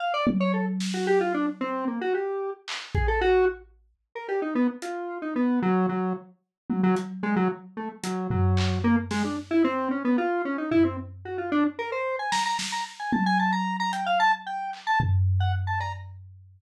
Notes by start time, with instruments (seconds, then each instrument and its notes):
0.00 lead 1 (square) F5
0.14 lead 1 (square) D5
0.27 high tom
0.40 lead 1 (square) C#5
0.53 lead 1 (square) A4
0.80 snare
0.94 lead 1 (square) F#4
1.07 lead 1 (square) G4
1.21 lead 1 (square) F4
1.34 lead 1 (square) D4
1.61 lead 1 (square) C4
1.87 lead 1 (square) A#3
2.01 lead 1 (square) F#4
2.14 lead 1 (square) G4
2.68 clap
2.95 lead 1 (square) G#4, kick
3.08 lead 1 (square) A4
3.21 lead 1 (square) F#4
4.15 lead 1 (square) A#4
4.28 lead 1 (square) G4, cowbell
4.42 lead 1 (square) D#4
4.55 lead 1 (square) B3
4.82 lead 1 (square) F4, closed hi-hat
5.22 lead 1 (square) D#4
5.36 lead 1 (square) B3
5.62 lead 1 (square) F#3
5.89 lead 1 (square) F#3
6.70 lead 1 (square) F#3, high tom
6.83 lead 1 (square) F#3
6.96 closed hi-hat
7.23 lead 1 (square) G#3, cowbell
7.36 lead 1 (square) F#3
7.77 lead 1 (square) A3
8.03 lead 1 (square) F#3, closed hi-hat
8.30 lead 1 (square) F#3, floor tom
8.57 clap
8.84 lead 1 (square) A#3
9.11 lead 1 (square) G#3, snare
9.24 lead 1 (square) D4
9.51 lead 1 (square) E4
9.64 lead 1 (square) C4
9.91 lead 1 (square) C#4
10.05 lead 1 (square) B3
10.18 lead 1 (square) F4
10.45 lead 1 (square) C#4
10.58 lead 1 (square) D#4
10.71 lead 1 (square) E4, floor tom
10.84 lead 1 (square) C4
11.25 lead 1 (square) F#4
11.38 lead 1 (square) F4
11.52 lead 1 (square) D4
11.79 lead 1 (square) A#4
11.92 lead 1 (square) C5
12.19 lead 1 (square) G#5
12.32 lead 1 (square) A#5, snare
12.46 lead 1 (square) A#5
12.59 snare
12.72 lead 1 (square) A#5
13.00 lead 1 (square) G#5
13.12 lead 1 (square) A5, high tom
13.26 lead 1 (square) G#5
13.39 lead 1 (square) A5
13.52 lead 1 (square) A#5
13.80 lead 1 (square) A#5
13.93 lead 1 (square) G5, closed hi-hat
14.06 lead 1 (square) F5
14.20 lead 1 (square) A5
14.46 lead 1 (square) G5
14.73 clap
14.87 lead 1 (square) A5
15.00 floor tom
15.40 lead 1 (square) F#5
15.67 lead 1 (square) A5
15.80 lead 1 (square) A#5, cowbell